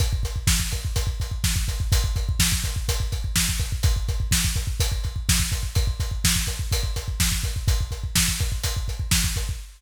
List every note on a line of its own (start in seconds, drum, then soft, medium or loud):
0.00 kick medium
0.00 closed hi-hat medium
0.13 kick medium
0.23 kick medium
0.23 closed hi-hat medium
0.36 kick medium
0.47 kick medium
0.47 snare medium
0.60 kick medium
0.71 kick medium
0.71 closed hi-hat medium
0.85 kick medium
0.96 kick medium
0.96 closed hi-hat medium
1.07 kick medium
1.20 kick medium
1.20 closed hi-hat medium
1.31 kick medium
1.44 kick medium
1.44 snare medium
1.56 kick medium
1.68 kick medium
1.68 closed hi-hat medium
1.80 kick medium
1.92 kick medium
1.92 closed hi-hat medium
2.04 kick medium
2.16 kick medium
2.16 closed hi-hat medium
2.29 kick medium
2.39 kick medium
2.39 snare loud
2.52 kick medium
2.64 kick medium
2.64 closed hi-hat medium
2.76 kick medium
2.89 kick medium
2.89 closed hi-hat medium
3.00 kick medium
3.12 kick medium
3.12 closed hi-hat medium
3.24 kick medium
3.36 kick medium
3.36 snare medium
3.49 kick medium
3.60 kick medium
3.60 closed hi-hat medium
3.72 kick medium
3.83 kick loud
3.83 closed hi-hat medium
3.96 kick medium
4.08 kick medium
4.08 closed hi-hat medium
4.20 kick medium
4.31 kick medium
4.31 snare medium
4.45 kick medium
4.56 kick medium
4.56 closed hi-hat medium
4.67 kick medium
4.80 kick medium
4.80 closed hi-hat medium
4.92 kick medium
5.04 kick medium
5.04 closed hi-hat soft
5.16 kick medium
5.29 kick medium
5.29 snare loud
5.40 kick medium
5.52 kick medium
5.52 closed hi-hat medium
5.63 kick medium
5.75 kick medium
5.75 closed hi-hat medium
5.87 kick medium
6.00 kick medium
6.00 closed hi-hat medium
6.11 kick medium
6.24 kick medium
6.24 snare loud
6.36 kick medium
6.47 kick medium
6.47 closed hi-hat medium
6.59 kick medium
6.72 kick medium
6.72 closed hi-hat medium
6.83 kick medium
6.96 kick medium
6.96 closed hi-hat medium
7.08 kick medium
7.20 kick medium
7.20 snare medium
7.32 kick medium
7.44 kick medium
7.44 closed hi-hat medium
7.56 kick medium
7.68 kick medium
7.68 closed hi-hat medium
7.81 kick medium
7.91 kick medium
7.91 closed hi-hat medium
8.04 kick medium
8.15 kick medium
8.15 snare loud
8.28 kick medium
8.39 kick medium
8.39 closed hi-hat medium
8.52 kick medium
8.63 kick medium
8.63 closed hi-hat medium
8.77 kick medium
8.88 kick medium
8.88 closed hi-hat medium
9.00 kick medium
9.11 kick medium
9.11 snare loud
9.24 kick medium
9.36 kick medium
9.36 closed hi-hat medium
9.49 kick medium